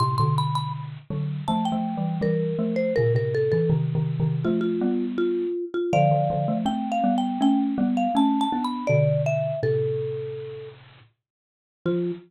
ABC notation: X:1
M:4/4
L:1/16
Q:1/4=81
K:Flyd
V:1 name="Marimba"
c' c' b b z4 a g3 _B3 c | _B B A A z4 F F3 F3 F | [df]4 (3g2 f2 g2 g z2 f (3a2 a2 b2 | d2 e2 A6 z6 |
F4 z12 |]
V:2 name="Xylophone"
[A,,C,] [B,,D,]5 [D,^F,]2 (3[=F,A,]2 [F,A,]2 [E,G,]2 [E,G,]2 [F,A,]2 | [_B,,_D,] [A,,C,]2 [D,_F,] (3[C,_E,]2 [C,E,]2 [C,E,]2 [=F,A,]2 [G,=B,]4 z2 | [D,F,] [D,F,] [D,F,] [F,A,] [A,C]2 [G,B,]2 [A,^C]2 [G,B,]2 [A,C]2 [B,D]2 | [B,,D,]4 [A,,C,]8 z4 |
F,4 z12 |]